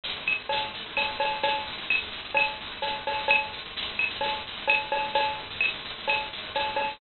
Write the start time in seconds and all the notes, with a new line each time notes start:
0.03 shaker
0.16 shaker
0.26 claves, shaker
0.38 shaker
0.49 cowbell, shaker
0.62 shaker
0.74 shaker
0.85 shaker
0.97 cowbell, claves, shaker
1.10 shaker
1.20 cowbell, shaker
1.31 shaker
1.43 cowbell, shaker
1.54 shaker
1.66 shaker
1.77 shaker
1.90 claves, shaker
2.02 shaker
2.12 shaker
2.24 shaker
2.34 cowbell, claves, shaker
2.47 shaker
2.60 shaker
2.71 shaker
2.82 cowbell, shaker
2.94 shaker
3.06 cowbell, shaker
3.18 shaker
3.28 cowbell, claves, shaker
3.41 shaker
3.52 shaker
3.65 shaker
3.76 shaker
3.88 shaker
3.99 claves, shaker
4.10 shaker
4.21 cowbell, shaker
4.33 shaker
4.47 shaker
4.56 shaker
4.68 cowbell, claves, shaker
4.81 shaker
4.92 cowbell, shaker
5.03 shaker
5.14 cowbell, shaker
5.28 shaker
5.38 shaker
5.50 shaker
5.61 claves, shaker
5.73 shaker
5.84 shaker
5.98 shaker
6.08 cowbell, claves, shaker
6.19 shaker
6.32 shaker
6.43 shaker
6.54 cowbell, shaker
6.67 shaker
6.76 cowbell, shaker
6.89 shaker